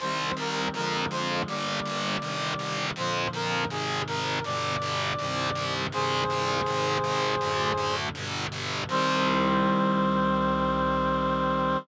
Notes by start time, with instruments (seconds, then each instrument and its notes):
0.00 electric bass (finger) C2, clarinet D#3 G3 C4 C5
0.37 electric bass (finger) C2, clarinet A#4
0.74 electric bass (finger) F2, clarinet D3 F3 G#3 A#4
1.11 electric bass (finger) F2, clarinet C5
1.48 electric bass (finger) G1, clarinet D3 G3 A#3 D5
1.85 electric bass (finger) G1
2.21 electric bass (finger) G1, clarinet C3 D#3 G3
2.59 electric bass (finger) G1
2.96 electric bass (finger) F2, clarinet A#2 D3 F3 C5
3.33 electric bass (finger) F2, clarinet A#4
3.69 electric bass (finger) G#1, clarinet G#2 C3 D#3 G#4
4.07 electric bass (finger) G#1, clarinet A#4
4.44 electric bass (finger) G1, clarinet G2 B2 D3 D5
4.82 electric bass (finger) G1
5.19 electric bass (finger) C2, clarinet G2 C3 D#3
5.55 electric bass (finger) C2
5.92 electric bass (finger) C2, clarinet G2 C3 D#3 G#4 C5
6.30 electric bass (finger) C2
6.66 electric bass (finger) G#1, clarinet G#2 C3 D#3
7.04 electric bass (finger) G#1
7.41 electric bass (finger) D2, clarinet F#2 A2 D3
7.77 electric bass (finger) D2
8.15 electric bass (finger) G1, clarinet G2 B2 D3
8.52 electric bass (finger) G1
8.89 electric bass (finger) C2, clarinet D#3 G3 C4 C5